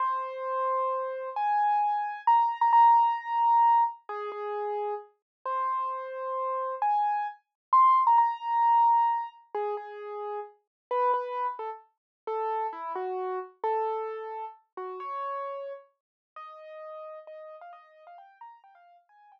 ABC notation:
X:1
M:3/4
L:1/16
Q:1/4=132
K:Ab
V:1 name="Acoustic Grand Piano"
c12 | a8 b3 b | b12 | A2 A6 z4 |
c12 | a4 z4 c'3 b | b12 | A2 A6 z4 |
[K:A] B2 B3 z A z5 | A4 E2 F4 z2 | A8 z2 F2 | c8 z4 |
[K:Ab] e8 e3 f | e3 f g2 b2 g f2 z | a2 g6 z4 |]